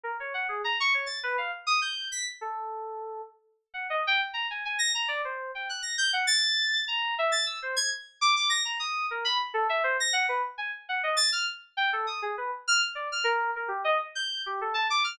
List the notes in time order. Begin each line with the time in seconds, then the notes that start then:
0.03 A#4
0.20 C#5
0.34 F#5
0.49 G#4
0.64 A#5
0.80 C#6
0.94 C#5
1.06 A6
1.23 B4
1.38 F5
1.67 D#6
1.81 G6
2.12 B6
2.41 A4
3.74 F#5
3.90 D#5
4.07 G5
4.34 A#5
4.50 G#5
4.65 G#5
4.79 A#6
4.95 A#5
5.08 D5
5.25 C5
5.55 G5
5.69 F#6
5.82 A#6
5.98 G6
6.13 F#5
6.27 A6
6.88 A#5
7.18 E5
7.32 A6
7.46 E6
7.62 C5
7.76 G#6
8.21 D6
8.36 D6
8.50 A#6
8.65 A#5
8.79 D#6
9.11 A#4
9.25 B5
9.54 A4
9.69 E5
9.84 C5
10.00 A#6
10.13 F#5
10.29 B4
10.58 G#5
10.89 F#5
11.03 D#5
11.17 A6
11.32 F6
11.77 G5
11.93 A4
12.07 D#6
12.22 G#4
12.37 B4
12.68 F6
12.95 D5
13.12 F6
13.24 A#4
13.56 A#4
13.68 G4
13.84 D#5
14.15 G6
14.46 G4
14.61 A4
14.74 A5
14.90 D6
15.04 F6